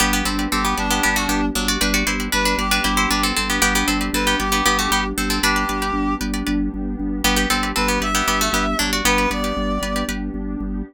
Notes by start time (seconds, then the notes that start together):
0.00 G1 B3 D4 G4 B4 D5
0.13 B3 G4 B4 D5
0.25 G1 C4 G4 A4 B4 D5
0.39 G4 B4 D5
0.51 G1 C4 G4 A4
0.65 B3 G4
0.77 G1 D4 G4 B4 D5
0.91 B3 G4 B4 D5
1.03 G1 B3 G4 B4 D5
1.16 A3 F#4
1.29 G1 B3 G4
1.55 G1 F#3 D4
1.68 F#4 D5
1.81 G1 B3 D4 G4 B4 D5
1.94 F#4 G4 B4 D5
2.07 G1 E4 G4 B4 C5 D5
2.20 G4 B4 D5
2.32 G1 D4 B4
2.45 D4 B4
2.58 G1 G4 B4 D5
2.71 D4 G4 B4 D5
2.84 G1 E4 G4 B4 C5 D5
2.97 E4 C5
3.10 G1 D4 B4
3.23 C4 A4
3.37 G1 C4 A4
3.50 B3 G4
3.62 G1 B3 D4 G4 B4 D5
3.75 B3 G4 B4 D5
3.88 G1 C4 G4 A4 B4 D5
4.01 G4 B4 D5
4.13 G1 C4 A4 B4
4.27 B3 G4
4.40 G1 G4 B4 D5
4.52 B3 G4 B4 D5
4.66 G1 B3 G4 B4 D5
4.79 A3 F#4
4.91 G1 B3 G4
5.18 G1 C4 A4
5.30 C4 A4
5.43 G1 B3 D4 G4 B4 D5
5.56 G4 B4 D5
5.69 G1 G4 B4 D5
5.82 G4 B4 D5
5.94 G1
6.21 G1 G4 B4 D5
6.34 G4 B4 D5
6.47 G1 G4 B4 D5
6.74 G1
6.99 G1
7.24 G1 B3 D4 G4 B4 D5
7.36 B3 G4 B4 D5
7.50 G1 C4 G4 A4 B4 D5
7.63 G4 B4 D5
7.76 G1 C4 A4 B4
7.88 B3 G4
8.00 G1 G4 B4 D5 E5
8.15 B3 G4 B4 D5
8.27 G1 B3 G4 B4 D5
8.41 A3 F#4
8.53 G1 B3 G4
8.79 G1 F#3 D4
8.93 F#4 D5
9.05 G1 B3 D4 G4 B4 D5
9.18 G4 B4 D5
9.30 G1 G4 B4 D5
9.44 G4 B4 D5
9.57 G1
9.82 G1 G4 B4 D5
9.96 G4 B4 D5
10.08 G1 G4 B4 D5
10.34 G1
10.60 G1